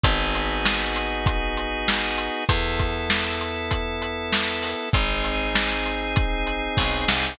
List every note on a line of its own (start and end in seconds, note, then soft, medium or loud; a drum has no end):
0.03 2.29 G#1 medium
0.03 2.44 B3 medium
0.03 2.44 D#4 loud
0.03 2.44 F#4 loud
0.03 2.44 G#4 loud
0.03 kick loud
0.03 closed hi-hat loud
0.35 closed hi-hat medium
0.65 snare loud
0.96 closed hi-hat medium
1.26 kick loud
1.26 closed hi-hat loud
1.57 closed hi-hat medium
1.88 snare loud
2.18 closed hi-hat medium
2.49 4.74 E2 medium
2.49 4.89 B3 loud
2.49 4.89 E4 medium
2.49 4.89 A4 medium
2.49 kick loud
2.49 closed hi-hat loud
2.79 kick medium
2.79 closed hi-hat medium
3.10 snare loud
3.41 closed hi-hat medium
3.71 kick medium
3.71 closed hi-hat loud
4.02 closed hi-hat medium
4.32 snare loud
4.63 open hi-hat medium
4.93 6.68 G#1 medium
4.93 7.34 C4 medium
4.93 7.34 D#4 loud
4.93 7.34 G#4 loud
4.93 kick loud
4.93 closed hi-hat loud
5.24 closed hi-hat medium
5.55 snare loud
5.86 closed hi-hat medium
6.16 kick loud
6.16 closed hi-hat loud
6.47 closed hi-hat medium
6.77 7.05 B1 medium
6.77 kick loud
6.77 snare medium
7.08 7.36 C2 medium
7.08 snare loud